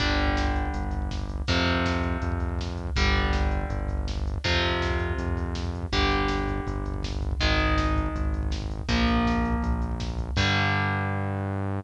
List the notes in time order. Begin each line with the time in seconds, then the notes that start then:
0.00 G1 D3 G3, kick, closed hi-hat
0.09 kick
0.19 kick, closed hi-hat
0.27 kick
0.36 kick, snare
0.47 kick
0.56 kick, closed hi-hat
0.65 kick
0.74 G1, kick, closed hi-hat
0.83 kick
0.91 kick, closed hi-hat
1.02 kick
1.11 kick, snare
1.21 kick
1.29 kick, closed hi-hat
1.38 kick
1.47 F2 C3 F3, kick, closed hi-hat
1.58 kick
1.66 kick, closed hi-hat
1.76 kick
1.85 kick, snare
1.96 kick
2.03 kick, closed hi-hat
2.13 kick
2.22 F2, kick, closed hi-hat
2.32 kick
2.40 kick, closed hi-hat
2.49 kick
2.59 kick, snare
2.68 kick
2.77 kick, closed hi-hat
2.87 kick
2.96 G1 D3 G3, kick, closed hi-hat
3.05 kick
3.16 kick, closed hi-hat
3.24 kick
3.33 kick, snare
3.42 kick
3.51 kick, closed hi-hat
3.61 kick
3.70 G1, kick, closed hi-hat
3.80 kick
3.88 kick, closed hi-hat
3.98 kick
4.08 kick, snare
4.18 kick
4.25 kick, closed hi-hat
4.34 kick
4.44 F2 C3 F3, kick, closed hi-hat
4.53 kick
4.62 kick, closed hi-hat
4.72 kick
4.82 kick, snare
4.91 kick
4.99 kick, closed hi-hat
5.09 kick
5.18 F2, kick, closed hi-hat
5.28 kick
5.37 kick, closed hi-hat
5.46 kick
5.55 kick, snare
5.65 kick
5.74 kick, closed hi-hat
5.82 kick
5.92 G1 D3 G3, kick, closed hi-hat
6.01 kick
6.10 kick, closed hi-hat
6.19 kick
6.28 kick, snare
6.38 kick
6.48 kick, closed hi-hat
6.57 kick
6.66 G1, kick, closed hi-hat
6.76 kick
6.86 kick, closed hi-hat
6.94 kick
7.03 kick, snare
7.12 kick
7.22 kick, closed hi-hat
7.31 kick
7.40 G#1 D#3 G#3, kick, closed hi-hat
7.51 kick
7.59 kick, closed hi-hat
7.68 kick
7.78 kick, snare
7.88 kick
7.96 kick, closed hi-hat
8.06 kick
8.14 G#1, kick, closed hi-hat
8.25 kick
8.34 kick, closed hi-hat
8.43 kick
8.51 kick, snare
8.62 kick
8.70 kick, closed hi-hat
8.79 kick
8.88 A#1 F3 A#3, kick, closed hi-hat
8.98 kick
9.07 kick, closed hi-hat
9.17 kick
9.25 kick, snare
9.36 kick
9.43 kick, closed hi-hat
9.52 kick
9.62 A#1, kick, closed hi-hat
9.72 kick
9.82 kick, closed hi-hat
9.92 kick
10.00 kick, snare
10.09 kick
10.18 kick, closed hi-hat
10.29 kick
10.36 G2 D3 G3, kick, crash